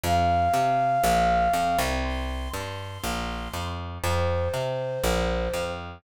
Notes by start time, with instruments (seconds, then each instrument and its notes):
0.04 electric bass (finger) F2, flute F5
0.54 electric bass (finger) C3
1.04 electric bass (finger) A#1
1.53 electric bass (finger) F2
1.79 electric bass (finger) C2
2.04 flute C6
2.54 electric bass (finger) G2, flute C6
3.04 electric bass (finger) A#1
3.54 electric bass (finger) F2
4.04 electric bass (finger) F2, flute C5
4.54 electric bass (finger) C3
5.04 electric bass (finger) A#1
5.54 electric bass (finger) F2